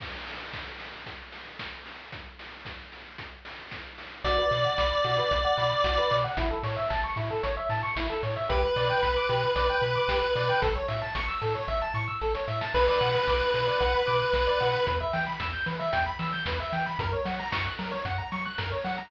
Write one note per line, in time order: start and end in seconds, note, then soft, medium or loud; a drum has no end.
0.00 kick medium
0.00 crash medium
0.27 open hi-hat medium
0.53 kick medium
0.53 snare medium
0.79 open hi-hat medium
1.06 kick medium
1.06 closed hi-hat medium
1.32 open hi-hat medium
1.59 kick medium
1.59 snare medium
1.86 open hi-hat medium
2.12 kick medium
2.12 closed hi-hat medium
2.39 open hi-hat medium
2.65 kick medium
2.65 snare medium
2.92 open hi-hat medium
3.18 kick medium
3.18 closed hi-hat medium
3.45 open hi-hat medium
3.71 kick medium
3.71 snare medium
3.98 open hi-hat medium
4.24 4.39 B1 medium
4.24 4.37 F#4 medium
4.24 6.17 D5 medium
4.24 kick medium
4.24 closed hi-hat medium
4.38 4.50 B4 medium
4.51 4.66 B2 medium
4.51 4.63 D5 medium
4.51 open hi-hat medium
4.64 4.76 F#5 medium
4.78 4.93 B1 medium
4.78 4.90 B5 medium
4.78 kick medium
4.78 snare medium
4.91 5.03 D6 medium
5.04 5.19 B2 medium
5.04 5.16 F#4 medium
5.04 open hi-hat medium
5.18 5.30 B4 medium
5.31 5.46 B1 medium
5.31 5.43 D5 medium
5.31 kick medium
5.31 closed hi-hat medium
5.44 5.56 F#5 medium
5.57 5.72 B2 medium
5.57 5.70 B5 medium
5.57 open hi-hat medium
5.71 5.83 D6 medium
5.84 5.99 B1 medium
5.84 5.96 F#4 medium
5.84 kick medium
5.84 snare medium
5.98 6.10 B4 medium
6.11 6.26 B2 medium
6.11 6.23 D5 medium
6.11 open hi-hat medium
6.24 6.36 F#5 medium
6.37 6.52 A1 medium
6.37 6.49 E4 medium
6.37 kick medium
6.37 closed hi-hat loud
6.51 6.63 A4 medium
6.63 6.78 A2 medium
6.63 6.76 C#5 medium
6.63 open hi-hat medium
6.76 6.88 E5 medium
6.90 7.05 A1 medium
6.90 7.02 A5 medium
6.90 kick medium
6.90 snare medium
7.04 7.16 C#6 medium
7.16 7.31 A2 medium
7.16 7.29 E4 medium
7.16 open hi-hat medium
7.31 7.42 A4 medium
7.43 7.58 A1 medium
7.43 7.55 C#5 medium
7.43 kick medium
7.43 closed hi-hat medium
7.57 7.69 E5 medium
7.69 7.84 A2 medium
7.69 7.82 A5 medium
7.69 open hi-hat medium
7.83 7.95 C#6 medium
7.96 8.11 A1 medium
7.96 8.08 E4 medium
7.96 kick medium
7.96 snare loud
8.10 8.22 A4 medium
8.23 8.37 A2 medium
8.23 8.35 C#5 medium
8.23 open hi-hat medium
8.36 8.48 E5 medium
8.49 8.64 B1 medium
8.49 8.61 G4 medium
8.49 10.61 B4 medium
8.49 kick medium
8.49 closed hi-hat medium
8.63 8.75 B4 medium
8.76 8.91 B2 medium
8.76 8.88 D5 medium
8.76 open hi-hat medium
8.89 9.01 G5 medium
9.03 9.17 B1 medium
9.03 9.14 B5 medium
9.03 kick medium
9.03 snare medium
9.16 9.28 D6 medium
9.29 9.44 B2 medium
9.29 9.41 G4 medium
9.29 open hi-hat medium
9.43 9.55 B4 medium
9.56 9.70 B1 medium
9.56 9.67 D5 medium
9.56 kick medium
9.56 closed hi-hat medium
9.70 9.82 G5 medium
9.82 9.96 B2 medium
9.82 9.94 B5 medium
9.82 open hi-hat medium
9.95 10.07 D6 medium
10.08 10.23 B1 medium
10.08 10.21 G4 medium
10.08 kick medium
10.08 snare loud
10.22 10.34 B4 medium
10.35 10.50 B2 medium
10.35 10.48 D5 medium
10.35 open hi-hat medium
10.49 10.61 G5 medium
10.62 10.77 A1 medium
10.62 10.74 A4 medium
10.62 kick loud
10.62 closed hi-hat medium
10.76 10.87 C#5 medium
10.88 11.03 A2 medium
10.88 11.00 E5 medium
10.88 open hi-hat medium
11.02 11.14 A5 medium
11.15 11.30 A1 medium
11.15 11.27 C#6 medium
11.15 kick medium
11.15 snare medium
11.28 11.40 E6 medium
11.41 11.56 A2 medium
11.41 11.53 A4 medium
11.41 open hi-hat medium
11.55 11.67 C#5 medium
11.68 11.82 A1 medium
11.68 11.80 E5 medium
11.68 kick medium
11.68 snare medium
11.82 11.94 A5 medium
11.94 12.09 A2 medium
11.94 12.06 C#6 medium
11.94 snare medium
12.08 12.19 E6 medium
12.21 12.36 A1 medium
12.21 12.33 A4 medium
12.21 snare medium
12.35 12.46 C#5 medium
12.35 snare medium
12.48 12.62 A2 medium
12.48 12.60 E5 medium
12.48 snare medium
12.61 12.73 A5 medium
12.61 snare medium
12.74 12.89 B1 medium
12.74 12.86 B4 medium
12.74 14.86 B4 medium
12.74 kick medium
12.74 crash medium
12.88 13.00 D5 medium
13.01 13.15 B2 medium
13.01 13.13 F#5 medium
13.01 open hi-hat medium
13.14 13.26 B5 medium
13.27 13.42 B1 medium
13.27 13.39 D6 medium
13.27 kick medium
13.27 snare medium
13.40 13.52 F#6 medium
13.54 13.69 B2 medium
13.54 13.66 B4 medium
13.54 open hi-hat medium
13.67 13.79 D5 medium
13.80 13.95 B1 medium
13.80 13.92 F#5 medium
13.80 kick medium
13.80 closed hi-hat medium
13.94 14.06 B5 medium
14.07 14.22 B2 medium
14.07 14.19 D6 medium
14.07 open hi-hat medium
14.20 14.32 F#6 medium
14.33 14.48 B1 medium
14.33 14.46 B4 medium
14.33 kick medium
14.33 snare medium
14.47 14.59 D5 medium
14.60 14.75 B2 medium
14.60 14.72 F#5 medium
14.60 open hi-hat medium
14.73 14.85 B5 medium
14.87 15.02 E2 medium
14.87 14.99 B4 medium
14.87 kick medium
14.87 closed hi-hat medium
15.00 15.12 E5 medium
15.13 15.28 E3 medium
15.13 15.25 G5 medium
15.13 open hi-hat medium
15.27 15.38 B5 medium
15.40 15.55 E2 medium
15.40 15.52 E6 medium
15.40 kick medium
15.40 snare medium
15.53 15.65 G6 medium
15.66 15.81 E3 medium
15.66 15.78 B4 medium
15.66 open hi-hat medium
15.79 15.91 E5 medium
15.92 16.08 E2 medium
15.92 16.04 G5 medium
15.92 kick medium
15.92 closed hi-hat loud
16.06 16.18 B5 medium
16.19 16.34 E3 medium
16.19 16.31 E6 medium
16.19 open hi-hat medium
16.33 16.45 G6 medium
16.46 16.60 E2 medium
16.46 16.58 B4 medium
16.46 kick medium
16.46 snare loud
16.60 16.72 E5 medium
16.72 16.87 E3 medium
16.72 16.85 G5 medium
16.72 open hi-hat medium
16.86 16.98 B5 medium
16.99 17.13 F#2 medium
16.99 17.12 A#4 medium
16.99 kick loud
16.99 closed hi-hat medium
17.13 17.25 C#5 medium
17.25 17.40 F#3 medium
17.25 17.37 F#5 medium
17.25 open hi-hat medium
17.39 17.51 A#5 medium
17.52 17.67 F#2 medium
17.52 17.64 C#6 medium
17.52 kick medium
17.52 snare loud
17.65 17.77 F#6 medium
17.79 17.94 F#3 medium
17.79 17.91 A#4 medium
17.79 open hi-hat medium
17.91 18.03 C#5 medium
18.05 18.19 F#2 medium
18.05 18.17 F#5 medium
18.05 kick medium
18.05 closed hi-hat medium
18.18 18.30 A#5 medium
18.32 18.47 F#3 medium
18.32 18.44 C#6 medium
18.32 open hi-hat medium
18.45 18.57 F#6 medium
18.58 18.73 F#2 medium
18.58 18.70 A#4 medium
18.58 kick medium
18.58 snare medium
18.72 18.84 C#5 medium
18.84 18.99 F#3 medium
18.84 18.96 F#5 medium
18.84 open hi-hat medium
18.98 19.10 A#5 medium